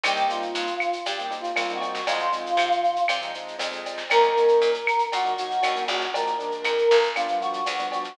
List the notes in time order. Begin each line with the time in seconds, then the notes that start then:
0.03 C2 G3 A#3 C4 D#4 G4, cowbell, claves, shaker
0.16 shaker
0.28 G3 A#3 C4 D#4 F4, shaker
0.42 shaker
0.55 G2, shaker
0.67 shaker
0.80 claves, shaker
0.93 shaker
1.06 G2 G4, cowbell, shaker
1.19 G3 A#3 C4 D#4, shaker
1.31 G3 A#3 C4 D#4, shaker
1.40 F4
1.44 shaker
1.56 C2 G3 A#3 C4 D#4, cowbell, claves, shaker
1.69 G3 A#3 C4 D#4, shaker
1.74 F#4
1.81 cowbell, shaker
1.94 snare, shaker
2.07 F2 F3 G#3 C4 D#4 F4, cowbell, shaker
2.19 shaker
2.32 F3 G#3 C4 D#4, shaker
2.46 shaker
2.57 C3, claves, shaker
2.72 shaker
2.84 shaker
2.96 shaker
3.08 C3, cowbell, claves, shaker
3.21 F3 G#3 C4 D#4, shaker
3.34 F3 G#3 C4 D#4, shaker
3.48 shaker
3.59 F2 F3 G#3 C4 D#4, cowbell, shaker
3.72 F3 G#3 C4 D#4, shaker
3.86 cowbell, shaker
3.97 snare, shaker
4.10 D#2 F#3 A#3 C#4 D#4 A#4, cowbell, claves, shaker
4.23 shaker
4.37 F#3 A#3 C#4 D#4, shaker
4.48 shaker
4.62 A#2, shaker
4.74 shaker
4.87 claves, shaker
4.99 shaker
5.12 A#2 F#4, cowbell, shaker
5.24 F#3 A#3 C#4 D#4, shaker
5.38 F#3 A#3 C#4 D#4 F#4, shaker
5.51 shaker
5.63 D#2 F#3 A#3 C#4 D#4, cowbell, claves, shaker
5.75 F#3 A#3 C#4 D#4, shaker
5.88 A#1 F#4, cowbell, shaker
6.01 snare, shaker
6.14 F3 G#3 A#3 D4 A#4, cowbell, shaker
6.26 shaker
6.39 F3 G#3 A#3 D4, shaker
6.51 shaker
6.64 F2, claves, shaker
6.78 shaker
6.91 G1, shaker
7.03 shaker
7.15 F3 G3 B3 D4 F4, cowbell, claves, shaker
7.28 F3 G3 B3 D4, shaker
7.40 F3 G3 B3 D4 F#4, shaker
7.53 shaker
7.66 D2 F3 G3 B3 D4, cowbell, shaker
7.79 F3 G3 B3 D4, shaker
7.92 F#4, cowbell, shaker
8.04 snare, shaker